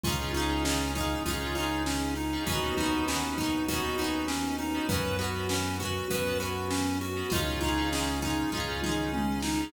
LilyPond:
<<
  \new Staff \with { instrumentName = "Lead 1 (square)" } { \time 4/4 \key des \major \tempo 4 = 99 f'8 ees'8 des'8 ees'8 f'8 ees'8 des'8 ees'8 | ges'8 ees'8 des'8 ees'8 ges'8 ees'8 des'8 ees'8 | ces''8 ges'8 des'8 ges'8 ces''8 ges'8 des'8 ges'8 | f'8 ees'8 des'8 ees'8 f'8 ees'8 des'8 ees'8 | }
  \new Staff \with { instrumentName = "Electric Piano 2" } { \time 4/4 \key des \major <des' ees' f' aes'>16 <des' ees' f' aes'>16 <des' ees' f' aes'>16 <des' ees' f' aes'>4~ <des' ees' f' aes'>16 <des' ees' f' aes'>16 <des' ees' f' aes'>4. <des' ees' f' aes'>16 | <ces' des' ees' ges'>16 <ces' des' ees' ges'>16 <ces' des' ees' ges'>16 <ces' des' ees' ges'>4~ <ces' des' ees' ges'>16 <ces' des' ees' ges'>16 <ces' des' ees' ges'>4. <ces' des' ees' ges'>16 | <ces' des' ges'>16 <ces' des' ges'>16 <ces' des' ges'>16 <ces' des' ges'>4~ <ces' des' ges'>16 <ces' des' ges'>16 <ces' des' ges'>4. <ces' des' ges'>16 | <des' ees' f' aes'>16 <des' ees' f' aes'>16 <des' ees' f' aes'>16 <des' ees' f' aes'>4~ <des' ees' f' aes'>16 <des' ees' f' aes'>16 <des' ees' f' aes'>4. <des' ees' f' aes'>16 | }
  \new Staff \with { instrumentName = "Acoustic Guitar (steel)" } { \time 4/4 \key des \major <des' ees' f' aes'>8 <des' ees' f' aes'>8 <des' ees' f' aes'>8 <des' ees' f' aes'>8 <des' ees' f' aes'>8 <des' ees' f' aes'>4. | <ces' des' ees' ges'>8 <ces' des' ees' ges'>8 <ces' des' ees' ges'>8 <ces' des' ees' ges'>8 <ces' des' ees' ges'>8 <ces' des' ees' ges'>4. | <ces' des' ges'>8 <ces' des' ges'>8 <ces' des' ges'>8 <ces' des' ges'>8 <ces' des' ges'>8 <ces' des' ges'>4. | <des' ees' f' aes'>8 <des' ees' f' aes'>8 <des' ees' f' aes'>8 <des' ees' f' aes'>8 <des' ees' f' aes'>8 <des' ees' f' aes'>4. | }
  \new Staff \with { instrumentName = "Synth Bass 1" } { \clef bass \time 4/4 \key des \major des,2 des,2 | ees,2 ees,2 | ges,2 ges,2 | des,2 des,2 | }
  \new Staff \with { instrumentName = "String Ensemble 1" } { \time 4/4 \key des \major <des' ees' f' aes'>1 | <ces' des' ees' ges'>1 | <ces' des' ges'>1 | <des' ees' f' aes'>1 | }
  \new DrumStaff \with { instrumentName = "Drums" } \drummode { \time 4/4 <hh bd>8 hh8 sn8 <hh bd>8 <hh bd>8 hh8 sn8 hh8 | <hh bd>8 <hh bd>8 sn8 <hh bd>8 <hh bd>8 hh8 sn8 hh8 | <hh bd>8 hh8 sn8 <hh bd>8 <hh bd>8 hh8 sn8 hh8 | <hh bd>8 <hh bd>8 sn8 <hh bd>8 <bd tomfh>8 toml8 tommh8 sn8 | }
>>